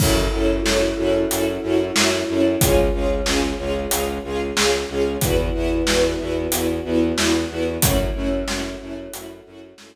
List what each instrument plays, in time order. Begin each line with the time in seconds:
0.00 violin F#2, string ensemble 1 C#4 E4 F#4 A4, choir aahs C#4 E4 F#4 A4, kick, crash
0.33 violin F#2, string ensemble 1 C#4 E4 F#4 A4
0.65 violin F#2, string ensemble 1 C#4 E4 F#4 A4, snare
0.98 violin F#2, string ensemble 1 C#4 E4 F#4 A4
1.30 violin F#2, choir aahs C#4 E4 A4 C#5, string ensemble 1 C#4 E4 F#4 A4, closed hi-hat
1.63 violin F#2, string ensemble 1 C#4 E4 F#4 A4
1.96 violin F#2, string ensemble 1 C#4 E4 F#4 A4, snare
2.28 violin F#2, string ensemble 1 C#4 E4 F#4 A4
2.61 violin C#2, string ensemble 1 C#4 F4 G#4, choir aahs C#4 F4 G#4, kick, closed hi-hat
2.93 violin C#2, string ensemble 1 C#4 F4 G#4
3.26 violin C#2, string ensemble 1 C#4 F4 G#4, snare
3.59 violin C#2, string ensemble 1 C#4 F4 G#4
3.91 violin C#2, string ensemble 1 C#4 F4 G#4, choir aahs C#4 G#4 C#5, closed hi-hat
4.24 violin C#2, string ensemble 1 C#4 F4 G#4
4.57 violin C#2, string ensemble 1 C#4 F4 G#4, snare
4.89 violin C#2, string ensemble 1 C#4 F4 G#4
5.21 violin E2, string ensemble 1 B3 E4 F#4, choir aahs B3 E4 F#4, kick, closed hi-hat
5.54 violin E2, string ensemble 1 B3 E4 F#4
5.87 violin E2, string ensemble 1 B3 E4 F#4, snare
6.20 violin E2, string ensemble 1 B3 E4 F#4
6.52 violin E2, string ensemble 1 B3 E4 F#4, choir aahs B3 F#4 B4, closed hi-hat
6.85 violin E2, string ensemble 1 B3 E4 F#4
7.17 violin E2, string ensemble 1 B3 E4 F#4, snare
7.50 violin E2, string ensemble 1 B3 E4 F#4
7.82 violin F#2, choir aahs A3 C#4 E4 F#4, string ensemble 1 A3 C#4 E4 F#4, kick, closed hi-hat
8.15 violin F#2, string ensemble 1 A3 C#4 E4 F#4
8.48 violin F#2, string ensemble 1 A3 C#4 E4 F#4, snare
8.80 violin F#2, string ensemble 1 A3 C#4 E4 F#4
9.13 violin F#2, string ensemble 1 A3 C#4 E4 F#4, choir aahs A3 C#4 F#4 A4, closed hi-hat
9.46 violin F#2, string ensemble 1 A3 C#4 E4 F#4
9.78 violin F#2, string ensemble 1 A3 C#4 E4 F#4, snare